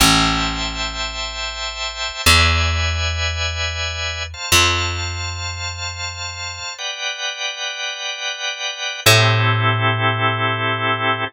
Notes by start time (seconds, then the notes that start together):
0.00 A1 C5 E5 G5 A5
2.26 E2 B4 D5 E5 G#5
4.34 C5 F5 A5
4.52 F2
6.78 B4 D5 F#5 G5
9.06 A2 C4 E4 G4 A4